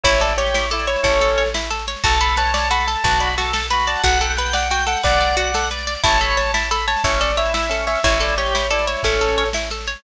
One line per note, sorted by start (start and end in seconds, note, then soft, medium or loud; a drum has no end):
0.03 0.96 A1 medium
0.03 0.33 E4 medium
0.03 0.20 E4 loud
0.03 0.20 C#5 medium
0.03 kick loud
0.03 snare medium
0.13 snare medium
0.20 0.36 A4 loud
0.20 0.35 D5 medium
0.20 snare loud
0.28 snare medium
0.37 0.66 G4 medium
0.37 0.53 C#5 medium
0.37 snare medium
0.46 snare medium
0.54 0.70 E4 medium
0.54 0.68 C#5 medium
0.54 snare loud
0.62 snare medium
0.70 1.05 E4 medium
0.70 0.86 A4 loud
0.70 0.85 D5 medium
0.70 snare medium
0.79 snare medium
0.87 1.02 C#5 medium
0.87 1.01 C#5 medium
0.87 snare medium
0.96 snare medium
1.03 1.96 A1 medium
1.03 1.43 C#4 medium
1.03 1.19 E4 medium
1.03 1.48 A4 medium
1.03 1.48 C#5 medium
1.03 kick loud
1.03 snare medium
1.12 snare medium
1.20 1.36 A4 medium
1.20 snare medium
1.28 snare medium
1.38 1.53 C#5 medium
1.38 snare medium
1.46 snare medium
1.54 1.70 E4 medium
1.54 snare loud
1.62 snare medium
1.70 1.85 A4 medium
1.70 snare medium
1.79 snare medium
1.87 2.03 C#5 medium
1.87 snare medium
1.96 snare medium
2.04 2.96 B1 medium
2.04 2.19 F#4 loud
2.04 2.35 A4 medium
2.04 2.20 A5 medium
2.04 kick loud
2.04 snare medium
2.12 snare medium
2.21 2.36 A4 medium
2.21 2.36 B5 medium
2.21 snare medium
2.28 snare medium
2.36 2.52 B4 medium
2.36 2.68 C#5 medium
2.36 2.52 A5 medium
2.36 snare loud
2.46 snare medium
2.54 2.69 D5 medium
2.54 2.68 A5 medium
2.54 snare loud
2.63 snare medium
2.70 2.86 F#4 medium
2.70 2.97 A4 medium
2.70 2.86 B5 medium
2.70 snare medium
2.80 snare medium
2.87 3.03 A4 medium
2.87 3.03 A5 medium
2.87 snare medium
2.96 snare medium
3.04 3.96 B1 medium
3.04 3.35 F#4 medium
3.04 3.20 B4 medium
3.04 3.20 A5 medium
3.04 kick loud
3.04 snare medium
3.12 snare medium
3.20 3.35 D5 medium
3.20 3.36 B5 medium
3.20 snare medium
3.30 snare medium
3.37 3.53 F#4 medium
3.37 3.67 A4 medium
3.37 3.53 A5 medium
3.37 snare loud
3.46 snare medium
3.53 3.68 A4 medium
3.53 3.70 A5 medium
3.53 snare loud
3.63 snare medium
3.70 4.02 F#4 medium
3.70 3.85 B4 medium
3.70 3.84 B5 medium
3.70 snare loud
3.79 snare medium
3.87 4.02 D5 medium
3.87 4.03 A5 medium
3.87 snare medium
3.96 snare medium
4.03 4.96 B1 medium
4.03 4.18 F#4 loud
4.03 4.20 F#5 medium
4.03 4.34 F#5 medium
4.03 kick loud
4.03 snare medium
4.13 snare medium
4.20 4.36 A4 medium
4.20 4.37 G5 medium
4.20 snare medium
4.30 snare medium
4.37 4.53 B4 loud
4.37 4.51 F#5 medium
4.37 4.68 G5 medium
4.37 snare medium
4.46 snare medium
4.53 4.68 D5 medium
4.53 4.70 F#5 medium
4.53 snare loud
4.63 snare medium
4.70 4.86 F#4 medium
4.70 4.98 G5 medium
4.70 4.86 G5 medium
4.70 snare medium
4.79 snare medium
4.87 5.02 A4 medium
4.87 5.03 F#5 medium
4.87 snare medium
4.96 snare medium
5.03 5.96 B1 medium
5.03 5.18 B4 medium
5.03 5.67 D5 medium
5.03 5.36 D5 medium
5.03 5.67 F#5 medium
5.03 kick loud
5.03 snare medium
5.13 snare medium
5.21 5.36 D5 medium
5.21 snare medium
5.29 snare medium
5.37 5.52 F#4 loud
5.37 5.69 F#5 medium
5.37 snare medium
5.46 snare medium
5.54 5.70 A4 loud
5.54 snare loud
5.63 snare medium
5.70 5.86 B4 medium
5.70 6.01 D5 medium
5.70 snare medium
5.79 snare medium
5.87 6.02 D5 medium
5.87 snare medium
5.95 snare medium
6.03 6.96 A1 medium
6.03 6.18 E4 loud
6.03 6.51 C#5 medium
6.03 6.20 A5 medium
6.03 kick loud
6.03 snare medium
6.12 snare medium
6.21 6.36 A4 medium
6.21 6.37 B5 medium
6.21 snare medium
6.29 snare medium
6.37 6.52 C#5 medium
6.37 6.52 A5 medium
6.37 snare loud
6.46 snare medium
6.54 6.69 E4 medium
6.54 6.70 A5 medium
6.54 snare loud
6.64 snare medium
6.71 6.86 A4 loud
6.71 6.85 B5 medium
6.71 snare loud
6.78 snare medium
6.87 7.03 C#5 medium
6.87 7.02 A5 medium
6.87 snare medium
6.97 snare medium
7.04 7.96 A1 medium
7.04 7.31 C#4 medium
7.04 7.19 E4 medium
7.04 7.19 C#5 medium
7.04 kick loud
7.04 snare medium
7.12 snare medium
7.21 7.36 A4 medium
7.21 7.37 D5 medium
7.21 snare medium
7.30 snare medium
7.37 7.67 E4 medium
7.37 7.52 C#5 loud
7.37 7.53 E5 medium
7.37 snare medium
7.45 snare medium
7.54 7.69 E4 medium
7.54 7.84 E5 medium
7.54 snare loud
7.63 snare medium
7.69 7.99 C#4 medium
7.69 7.86 A4 medium
7.69 snare loud
7.79 snare medium
7.87 8.02 C#5 medium
7.87 8.01 E5 medium
7.87 snare loud
7.95 snare medium
8.03 8.96 A1 medium
8.03 8.19 E4 loud
8.03 8.35 E4 medium
8.03 8.20 C#5 medium
8.03 kick loud
8.03 snare medium
8.13 snare medium
8.20 8.35 A4 loud
8.20 8.35 D5 medium
8.20 snare loud
8.28 snare medium
8.37 8.66 G4 medium
8.37 8.53 C#5 medium
8.37 snare medium
8.46 snare medium
8.54 8.70 E4 medium
8.54 8.68 C#5 medium
8.54 snare loud
8.63 snare medium
8.70 9.04 E4 medium
8.70 8.86 A4 loud
8.70 8.85 D5 medium
8.70 snare medium
8.79 snare medium
8.87 9.02 C#5 medium
8.87 9.01 C#5 medium
8.87 snare medium
8.97 snare medium
9.03 9.96 A1 medium
9.03 9.44 C#4 medium
9.03 9.20 E4 medium
9.03 9.48 A4 medium
9.03 9.48 C#5 medium
9.03 kick loud
9.03 snare medium
9.12 snare medium
9.21 9.36 A4 medium
9.21 snare medium
9.28 snare medium
9.37 9.53 C#5 medium
9.37 snare medium
9.46 snare medium
9.53 9.69 E4 medium
9.53 snare loud
9.63 snare medium
9.70 9.86 A4 medium
9.70 snare medium
9.80 snare medium
9.87 10.02 C#5 medium
9.87 snare medium
9.95 snare medium